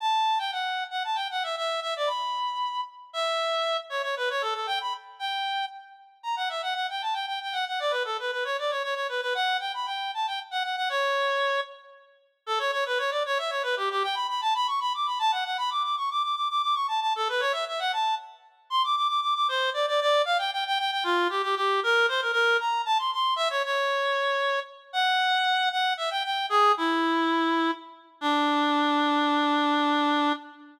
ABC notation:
X:1
M:6/8
L:1/16
Q:3/8=77
K:D
V:1 name="Clarinet"
a3 g f3 f a g f e | e2 e d b6 z2 | e6 c c B c A A | g b z2 g4 z4 |
[K:Bm] ^a f e f f g =a g g g f f | d B A B B c d c c c B B | f2 g b g2 a g z f f f | c6 z6 |
[K:D] A c c B c d c e c B G G | g b b a b c' b d' b a f f | b d' d' c' d' d' d' d' d' c' a a | A B c e e f a2 z4 |
[K:Dm] c' d' d' d' d' d' c2 d d d2 | f g g g g g F2 G G G2 | B2 c B B2 b2 a c' c'2 | e ^c c8 z2 |
[K:D] f6 f2 e g g2 | "^rit." ^G2 E8 z2 | D12 |]